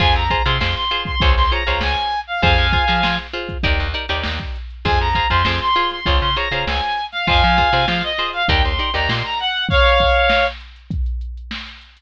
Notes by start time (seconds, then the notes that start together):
0.00 F2 F4 G#4 C5 G#5, kick, crash
0.15 F2 A#5, closed hi-hat
0.30 F4 G#4 C5, kick, closed hi-hat
0.45 C3 F4 G#4 C5 C6, closed hi-hat
0.61 F2 F4 G#4 C5, snare
0.76 C6, closed hi-hat
0.91 F4 G#4 C5, closed hi-hat
1.05 C6, kick, closed hi-hat
1.20 C#2 F4 G#4 C5 C#5, kick, closed hi-hat
1.37 C#2 C6, closed hi-hat
1.51 F4 G#4 C5 C#5 A#5, closed hi-hat
1.67 C#2 F4 G#4 C5 C#5, closed hi-hat
1.81 C#2 G#5, snare
1.96 closed hi-hat
2.12 closed hi-hat
2.27 F5
2.42 F2 F4 G#4 C5 F5 G#5, kick, closed hi-hat
2.58 F2, closed hi-hat
2.72 F4 G#4 C5, kick, closed hi-hat
2.88 F3 F4 G#4 C5, snare, closed hi-hat
3.03 F3 F4 G#4 C5, snare
3.18 closed hi-hat
3.33 F4 G#4 C5, closed hi-hat
3.49 kick, closed hi-hat
3.63 D#2 D#4 G4 A#4 D5, kick, closed hi-hat
3.79 D#2, closed hi-hat
3.94 D#4 G4 A#4 D5, closed hi-hat
4.08 D#2 D#4 G4 A#4 D5, closed hi-hat
4.23 D#2, snare
4.39 kick, closed hi-hat
4.56 closed hi-hat
4.70 closed hi-hat
4.85 F2 F4 G#4 C5 G#5, kick, closed hi-hat
4.99 F2 A#5, closed hi-hat
5.15 F4 G#4 C5, kick, snare, closed hi-hat
5.30 F2 F4 G#4 C5 C6, kick, snare, closed hi-hat
5.45 F2 F4 G#4 C5, snare
5.60 C6, snare, closed hi-hat
5.75 F4 G#4 C5, closed hi-hat
5.91 C6, snare, closed hi-hat
6.06 C#2 F4 G#4 C5 C#5, kick, closed hi-hat
6.21 C#3 C6, closed hi-hat
6.36 F4 G#4 C5 C#5 A#5, closed hi-hat
6.51 C#3 F4 G#4 C5 C#5, closed hi-hat
6.67 C#2 G#5, snare
6.82 closed hi-hat
6.96 closed hi-hat
7.12 F5, snare, closed hi-hat
7.27 F2 F4 G#4 C5 F5 G#5, kick, closed hi-hat
7.42 F3, closed hi-hat
7.58 F4 G#4 C5, kick, closed hi-hat
7.73 C3 F4 G#4 C5, closed hi-hat
7.88 F3 F4 G#4 C5 F5, snare
8.03 D#5, closed hi-hat
8.18 F4 G#4 C5, snare, closed hi-hat
8.33 F5, closed hi-hat
8.48 D#2 D#4 G4 A#4 D5 G5, kick, closed hi-hat
8.63 D#2 C6, closed hi-hat
8.79 D#4 G4 A#4 D5
8.94 D#2 D#4 G4 A#4 D5 A#5, closed hi-hat
9.09 A#2 C6, snare
9.24 A#5, closed hi-hat
9.40 F#5, snare, closed hi-hat
9.54 closed hi-hat
9.69 C#5 F5, kick, closed hi-hat
9.85 snare, closed hi-hat
10.00 kick, closed hi-hat
10.16 closed hi-hat
10.30 snare
10.46 closed hi-hat
10.60 closed hi-hat
10.76 closed hi-hat
10.91 kick, closed hi-hat
11.06 closed hi-hat
11.21 closed hi-hat
11.37 closed hi-hat
11.51 snare
11.67 closed hi-hat
11.81 closed hi-hat
11.97 closed hi-hat